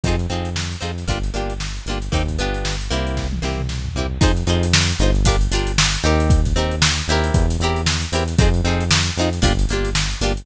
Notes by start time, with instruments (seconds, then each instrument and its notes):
0.03 synth bass 1 F2, pizzicato strings C4 D#4 F4, kick, closed hi-hat
0.08 pizzicato strings G#4
0.19 closed hi-hat
0.30 synth bass 1 F2, pizzicato strings C4 D#4 F4 G#4, closed hi-hat
0.45 closed hi-hat
0.56 snare
0.72 closed hi-hat
0.81 synth bass 1 F2, pizzicato strings C4 D#4 F4 G#4, closed hi-hat
0.98 snare, closed hi-hat
1.08 synth bass 1 G1, pizzicato strings A#3 D4 F4 G4, kick, closed hi-hat
1.23 closed hi-hat
1.34 synth bass 1 G1, pizzicato strings A#3 D4 F4 G4, closed hi-hat
1.50 closed hi-hat
1.60 snare
1.76 closed hi-hat
1.86 synth bass 1 G1, pizzicato strings A#3 D4 F4, closed hi-hat
1.90 pizzicato strings G4
2.02 closed hi-hat
2.12 synth bass 1 D#2, pizzicato strings A#3 C4 D#4 G4, kick, closed hi-hat
2.28 kick, closed hi-hat
2.38 synth bass 1 G1, pizzicato strings B3 D4 F4 G4, closed hi-hat
2.54 closed hi-hat
2.65 snare
2.81 closed hi-hat
2.91 synth bass 1 C2, pizzicato strings A#3 C4 E4 G4, closed hi-hat
3.07 closed hi-hat
3.17 kick, snare
3.32 high tom
3.42 synth bass 1 C2, pizzicato strings A#3 C4 E4 G4, snare
3.59 mid tom
3.69 snare
3.85 floor tom
3.95 synth bass 1 C2, pizzicato strings A#3 C4 E4 G4
4.21 synth bass 1 F2, pizzicato strings D#4 F4 G#4 C5, kick, closed hi-hat
4.37 closed hi-hat
4.47 synth bass 1 F2, pizzicato strings D#4 F4 G#4 C5, closed hi-hat
4.63 closed hi-hat
4.73 snare
4.89 closed hi-hat
4.99 synth bass 1 G1, pizzicato strings D#4 F4 G#4 C5, closed hi-hat
5.15 closed hi-hat
5.25 pizzicato strings D4 F4 G4 A#4, kick, closed hi-hat
5.41 closed hi-hat
5.51 synth bass 1 G1, pizzicato strings D4 F4 G4 A#4, snare, closed hi-hat
5.67 closed hi-hat
5.78 snare
5.93 closed hi-hat
6.03 synth bass 1 D#2, pizzicato strings C4 D#4 G4 A#4, closed hi-hat
6.20 closed hi-hat
6.30 kick, closed hi-hat
6.45 kick, closed hi-hat
6.56 synth bass 1 D#2, pizzicato strings C4 D#4 G4 A#4, closed hi-hat
6.71 closed hi-hat
6.82 snare
6.98 closed hi-hat
7.08 synth bass 1 D#2, pizzicato strings C4 E4 G4, snare, closed hi-hat
7.12 pizzicato strings A#4
7.24 closed hi-hat
7.34 synth bass 1 E2, kick, closed hi-hat
7.50 closed hi-hat
7.60 synth bass 1 E2, pizzicato strings C4 E4 G4, closed hi-hat
7.65 pizzicato strings A#4
7.76 closed hi-hat
7.86 snare
8.02 closed hi-hat
8.12 synth bass 1 E2, pizzicato strings C4 E4 G4 A#4, closed hi-hat
8.28 snare, closed hi-hat
8.38 synth bass 1 F2, pizzicato strings C4 D#4 F4 G#4, kick, closed hi-hat
8.54 closed hi-hat
8.64 synth bass 1 F2, pizzicato strings C4 D#4 F4 G#4, closed hi-hat
8.80 closed hi-hat
8.91 snare
9.06 closed hi-hat
9.17 synth bass 1 F2, pizzicato strings C4 D#4 F4, closed hi-hat
9.21 pizzicato strings G#4
9.33 snare, closed hi-hat
9.42 synth bass 1 G1, pizzicato strings A#3 D4 F4 G4, kick, closed hi-hat
9.59 closed hi-hat
9.69 synth bass 1 G1, pizzicato strings A#3 D4 F4, closed hi-hat
9.73 pizzicato strings G4
9.85 closed hi-hat
9.95 snare
10.11 closed hi-hat
10.21 synth bass 1 G1, pizzicato strings A#3 D4 F4 G4, closed hi-hat
10.37 closed hi-hat